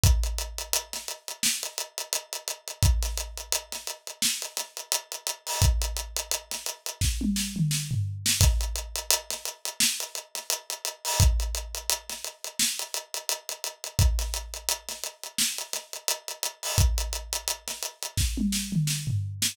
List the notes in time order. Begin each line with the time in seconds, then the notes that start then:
0.03 kick, closed hi-hat
0.23 closed hi-hat
0.38 closed hi-hat
0.58 closed hi-hat
0.73 closed hi-hat
0.93 snare, closed hi-hat
1.08 closed hi-hat
1.28 closed hi-hat
1.43 snare
1.63 closed hi-hat
1.78 closed hi-hat
1.98 closed hi-hat
2.13 closed hi-hat
2.33 closed hi-hat
2.48 closed hi-hat
2.68 closed hi-hat
2.83 kick, closed hi-hat
3.02 snare, closed hi-hat
3.17 closed hi-hat
3.37 closed hi-hat
3.52 closed hi-hat
3.72 snare, closed hi-hat
3.87 closed hi-hat
4.07 closed hi-hat
4.22 snare
4.42 closed hi-hat
4.57 snare, closed hi-hat
4.77 closed hi-hat
4.92 closed hi-hat
5.12 closed hi-hat
5.27 closed hi-hat
5.47 open hi-hat
5.62 kick, closed hi-hat
5.82 closed hi-hat
5.97 closed hi-hat
6.16 closed hi-hat
6.31 closed hi-hat
6.51 snare, closed hi-hat
6.66 closed hi-hat
6.86 closed hi-hat
7.01 kick, snare
7.21 high tom
7.36 snare
7.56 mid tom
7.71 snare
7.91 floor tom
8.26 snare
8.41 kick, closed hi-hat
8.61 closed hi-hat
8.76 closed hi-hat
8.95 closed hi-hat
9.10 closed hi-hat
9.30 snare, closed hi-hat
9.45 closed hi-hat
9.65 closed hi-hat
9.80 snare
10.00 closed hi-hat
10.15 closed hi-hat
10.35 snare, closed hi-hat
10.50 closed hi-hat
10.70 closed hi-hat
10.85 closed hi-hat
11.05 open hi-hat
11.20 kick, closed hi-hat
11.40 closed hi-hat
11.55 closed hi-hat
11.75 closed hi-hat
11.90 closed hi-hat
12.09 snare, closed hi-hat
12.24 closed hi-hat
12.44 closed hi-hat
12.59 snare
12.79 closed hi-hat
12.94 closed hi-hat
13.14 closed hi-hat
13.29 closed hi-hat
13.49 closed hi-hat
13.64 closed hi-hat
13.84 closed hi-hat
13.99 kick, closed hi-hat
14.19 snare, closed hi-hat
14.34 closed hi-hat
14.54 closed hi-hat
14.69 closed hi-hat
14.89 snare, closed hi-hat
15.03 closed hi-hat
15.23 closed hi-hat
15.38 snare
15.58 closed hi-hat
15.73 snare, closed hi-hat
15.93 closed hi-hat
16.08 closed hi-hat
16.28 closed hi-hat
16.43 closed hi-hat
16.63 open hi-hat
16.78 kick, closed hi-hat
16.98 closed hi-hat
17.13 closed hi-hat
17.33 closed hi-hat
17.48 closed hi-hat
17.68 snare, closed hi-hat
17.83 closed hi-hat
18.02 closed hi-hat
18.17 kick, snare
18.37 high tom
18.52 snare
18.72 mid tom
18.87 snare
19.07 floor tom
19.42 snare